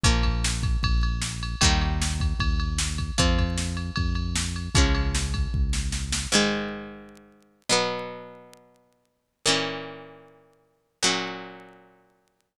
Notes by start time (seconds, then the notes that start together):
0.04 A#1 F3 A#3, kick, ride
0.23 kick, ride
0.44 snare
0.63 kick, ride
0.83 A#1, kick, ride
1.03 ride
1.22 snare
1.43 ride
1.61 D#2 D#3 G3 A#3, kick, ride
1.81 ride
2.02 snare
2.20 kick, ride
2.39 D#2, kick, ride
2.60 ride
2.78 snare
2.98 kick, ride
3.18 F2 F3 C4, kick, ride
3.38 kick, ride
3.58 snare
3.77 ride
3.96 F2, kick, ride
4.15 ride
4.36 snare
4.56 ride
4.75 C#2 F3 G#3 C#4, kick, ride
4.95 ride
5.15 snare
5.34 kick, ride
5.54 C#2, kick
5.73 snare
5.92 snare
6.12 snare
6.32 G#2 D#3 G#3
7.69 B2 F#3 B3
9.46 A#2 E3 C#4
11.03 A#2 F#3 C#4